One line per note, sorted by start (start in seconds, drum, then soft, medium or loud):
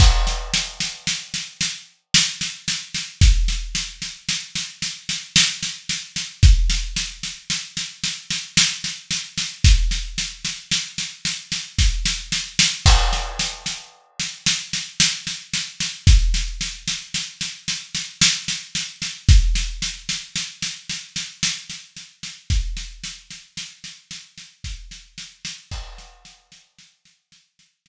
0.00 kick loud
0.00 snare medium
0.00 crash medium
0.27 snare medium
0.54 snare medium
0.80 snare medium
1.07 snare medium
1.34 snare medium
1.61 snare medium
2.14 snare loud
2.41 snare medium
2.68 snare medium
2.94 snare medium
3.21 kick loud
3.21 snare medium
3.48 snare medium
3.75 snare medium
4.02 snare medium
4.29 snare medium
4.55 snare medium
4.82 snare medium
5.09 snare medium
5.36 snare loud
5.63 snare medium
5.89 snare medium
6.16 snare medium
6.43 kick loud
6.43 snare medium
6.70 snare medium
6.96 snare medium
7.23 snare medium
7.50 snare medium
7.77 snare medium
8.04 snare medium
8.30 snare medium
8.57 snare loud
8.84 snare medium
9.11 snare medium
9.38 snare medium
9.64 kick loud
9.64 snare medium
9.91 snare medium
10.18 snare medium
10.45 snare medium
10.71 snare medium
10.98 snare medium
11.25 snare medium
11.52 snare medium
11.79 kick medium
11.79 snare medium
12.06 snare medium
12.32 snare medium
12.59 snare loud
12.86 kick medium
12.86 snare medium
12.86 crash loud
13.13 snare medium
13.39 snare medium
13.66 snare medium
14.20 snare medium
14.46 snare loud
14.73 snare medium
15.00 snare loud
15.27 snare medium
15.54 snare medium
15.80 snare medium
16.07 kick loud
16.07 snare medium
16.34 snare medium
16.61 snare medium
16.88 snare medium
17.14 snare medium
17.41 snare medium
17.68 snare medium
17.95 snare medium
18.21 snare loud
18.48 snare medium
18.75 snare medium
19.02 snare medium
19.29 kick loud
19.29 snare medium
19.55 snare medium
19.82 snare medium
20.09 snare medium
20.35 snare medium
20.63 snare medium
20.90 snare medium
21.16 snare medium
21.43 snare loud
21.70 snare medium
21.96 snare medium
22.23 snare medium
22.50 kick medium
22.50 snare medium
22.77 snare medium
23.04 snare medium
23.31 snare medium
23.57 snare medium
23.84 snare medium
24.11 snare medium
24.38 snare medium
24.64 kick medium
24.64 snare medium
24.91 snare medium
25.18 snare medium
25.45 snare loud
25.71 kick loud
25.71 snare medium
25.71 crash loud
25.98 snare medium
26.25 snare medium
26.52 snare medium
26.79 snare medium
27.05 snare medium
27.32 snare medium
27.59 snare medium
27.86 snare loud